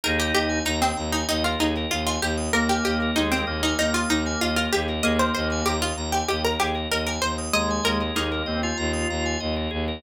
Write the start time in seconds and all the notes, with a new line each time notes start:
0.04 D#2 D#4 G#4 A#4
0.18 G4 A#4
0.34 D#2 G4 D#5
0.49 G#5
0.65 D#2 D#4 A#5
0.82 C4 D#6
0.97 D#2 A#5
1.12 D#4 G#5
1.29 D#2 D#4 D#5
1.44 F4 A#4
1.59 D#2 D#4 G#4
1.77 A#4
1.90 D#2 F4 D#5
2.07 F4 G#5
2.22 D#2 G4 A#5
2.37 D#6
2.53 D#2 A#3 A#4 A#5
2.69 G4 G#5
2.84 D#2 G4 D#5
3.02 A#4
3.16 D#2 G#3 D#4 G#4
3.32 C4 A#4
3.47 D#2 A#3 D#5
3.63 D#4 G#5
3.79 D#2 D#4 A#5
3.94 F4 D#6
4.09 D#2 D#4 A#5
4.26 G#5
4.41 D#2 F4 D#5
4.56 F4 A#4
4.73 D#2 G4 G#4
4.89 A#4
5.03 D#2 A#3 G#4 D#5
5.19 A#4 C5
5.34 D#2 C5 D#5
5.52 G#5
5.66 D#2 G4 A#5
5.82 F4 D#6
5.96 D#2 A#5
6.12 G4 G#5
6.28 D#2 G4 D#5
6.45 A#4
6.60 D#2 G4 G#4
6.74 A#4
6.91 D#2 A#4 D#5
7.07 A#4 G#5
7.22 D#2 C5 A#5
7.38 D#6
7.53 D#2 G#3 D#5 A#5
7.70 G#5
7.83 D#2 A#4 D#5
8.01 A#4
8.15 D#2 A#3 D#4 G#4
8.32 A#4
8.46 D#2 C4 D#5
8.63 F4 G#5
8.77 D#2 A#5
8.93 D#6
9.10 D#2 A#5
9.26 G#5
9.40 D#2 D#5
9.57 A#4
9.71 D#2 G#4
9.88 A#4